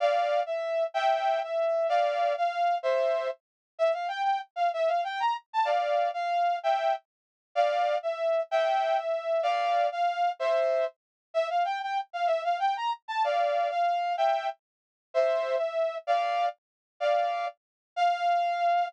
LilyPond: \new Staff { \time 6/8 \key f \major \tempo 4. = 127 <d'' f''>4. e''4. | <e'' g''>4. e''4. | <d'' f''>4. f''4. | <c'' e''>4. r4. |
e''8 f''8 g''8 g''8 r8 f''8 | e''8 f''8 g''8 bes''8 r8 a''8 | <d'' f''>4. f''4. | <e'' g''>4 r2 |
<d'' f''>4. e''4. | <e'' g''>4. e''4. | <d'' f''>4. f''4. | <c'' e''>4. r4. |
e''8 f''8 g''8 g''8 r8 f''8 | e''8 f''8 g''8 bes''8 r8 a''8 | <d'' f''>4. f''4. | <e'' g''>4 r2 |
<c'' e''>4. e''4. | <d'' f''>4. r4. | <d'' f''>4. r4. | f''2. | }